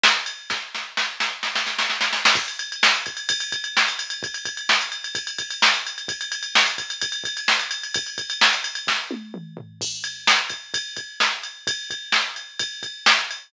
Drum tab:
CC |----|----------------|x---------------|----------------|
RD |--x-|----------------|-xxx-xxxxxxx-xxx|xxxx-xxxxxxx-xxx|
SD |o---|o-o-o-o-oooooooo|----o-------o---|----o-------o---|
T1 |----|----------------|----------------|----------------|
T2 |----|----------------|----------------|----------------|
FT |----|----------------|----------------|----------------|
BD |----|o---------------|o-----o-o-o-----|o-o-----o-o-----|

CC |----------------|----------------|x---------------|----------------|
RD |xxxx-xxxxxxx-xxx|xxxx-xxx--------|--x---x-x-x---x-|x-x---x-x-x---x-|
SD |----o-------o---|----o---o-------|----o-------o---|----o-------o---|
T1 |----------------|----------o-----|----------------|----------------|
T2 |----------------|------------o---|----------------|----------------|
FT |----------------|--------------o-|----------------|----------------|
BD |o-----o-o-o-----|o-o-----o-------|o-----o-o-o-----|o-o-----o-o-----|